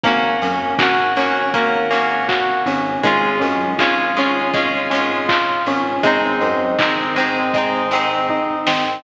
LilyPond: <<
  \new Staff \with { instrumentName = "Electric Piano 2" } { \time 4/4 \key aes \major \tempo 4 = 80 bes8 des'8 ges'8 des'8 bes8 des'8 ges'8 des'8 | aes8 des'8 f'8 des'8 aes8 des'8 f'8 des'8 | aes8 c'8 ees'8 c'8 aes8 c'8 ees'8 c'8 | }
  \new Staff \with { instrumentName = "Acoustic Guitar (steel)" } { \time 4/4 \key aes \major <bes des' ges'>4 <bes des' ges'>8 <bes des' ges'>8 <bes des' ges'>8 <bes des' ges'>4. | <aes des' f'>4 <aes des' f'>8 <aes des' f'>8 <aes des' f'>8 <aes des' f'>4. | <aes c' ees'>4 <aes c' ees'>8 <aes c' ees'>8 <aes c' ees'>8 <aes c' ees'>4. | }
  \new Staff \with { instrumentName = "Synth Bass 1" } { \clef bass \time 4/4 \key aes \major aes,,8 ges,8 aes,,2~ aes,,8 aes,,8 | aes,,8 ges,8 aes,,2~ aes,,8 aes,,8 | aes,,8 ges,8 aes,,2~ aes,,8 aes,,8 | }
  \new DrumStaff \with { instrumentName = "Drums" } \drummode { \time 4/4 <hh bd>8 hho8 <hc bd>8 hho8 <hh bd>8 hho8 <hc bd>8 hho8 | <hh bd>8 hho8 <hc bd>8 hho8 <hh bd>8 hho8 <hc bd>8 hho8 | <hh bd>8 hho8 <hc bd>8 hho8 <hh bd>8 hho8 bd8 sn8 | }
>>